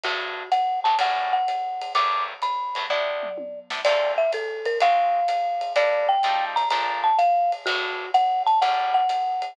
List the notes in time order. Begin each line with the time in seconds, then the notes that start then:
0.03 G2 F#3 A3 B3 F#4, ride
0.52 F#5, hi-hat pedal, ride
0.84 G2 F#3 A3 B3 A5, ride
0.99 A2 F#3 G3 C#4 F#5, ride
1.33 F#5
1.48 hi-hat pedal, ride
1.81 ride
1.95 G2 F#3 A3 B3 D6, ride
2.42 B5, hi-hat pedal, ride
2.75 G2 F#3 A3 B3, ride
2.89 C3 B3 D4 E4 D5, kick, floor tom
3.23 mid tom
3.38 high tom
3.70 C3 B3 D4 E4, snare
3.85 D3 A3 C4 F4 D5, crash, ride
4.18 E5
4.32 A4, kick, hi-hat pedal, ride
4.65 A#4, ride
4.80 G#3 C4 F4 F#4 F5, ride
5.28 hi-hat pedal, ride
5.61 ride
5.76 G3 A#3 D4 E4 D5, ride
6.09 G5
6.23 F3 G3 A3 D#4, kick, hi-hat pedal, ride
6.56 A#5, ride
6.70 A#2 F3 A3 D4 A#5, ride
7.04 A5
7.18 F5, hi-hat pedal, ride
7.52 ride
7.66 G2 F#3 A3 B3 F#4, kick, ride
8.14 F#5, hi-hat pedal, ride
8.47 A5, ride
8.61 A2 F#3 G3 C#4 F#5, kick, ride
8.94 F#5
9.09 hi-hat pedal, ride
9.42 ride